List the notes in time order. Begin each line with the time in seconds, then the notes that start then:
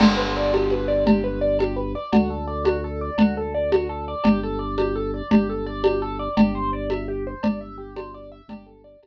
0.00 G1 G4, crash, cowbell, low conga
0.17 B4
0.37 D5
0.53 G4, cowbell, high conga
0.70 B4, high conga
0.88 D5
1.06 G4, cowbell, low conga
1.24 B4
1.41 D5
1.59 G4, cowbell, high conga
1.76 B4
1.95 D5
2.12 D2 F#4, cowbell, low conga
2.30 A4
2.47 D5
2.64 F#4, cowbell, high conga
2.84 A4
3.01 D5
3.18 D2 F#4, cowbell, low conga
3.37 A4
3.54 D5
3.72 F#4, cowbell, high conga
3.89 A4
4.08 D5
4.24 G1 G4, cowbell, low conga
4.43 A4
4.59 D5
4.78 G4, cowbell, high conga
4.96 A4
5.14 D5
5.31 G1 G4, cowbell, low conga
5.49 A4
5.66 D5
5.84 G4, cowbell, high conga
6.02 A4
6.19 D5
6.37 G1 G4, cowbell, low conga
6.55 C5
6.73 D5
6.90 E5, cowbell, high conga
7.08 G4
7.27 C5
7.43 G1 D5, cowbell, low conga
7.61 E5
7.78 G4
7.96 C5, cowbell, high conga
8.14 D5
8.32 E5
8.48 G1 G4, cowbell, low conga
8.66 A4
8.84 D5
9.03 G1 G4, cowbell, high conga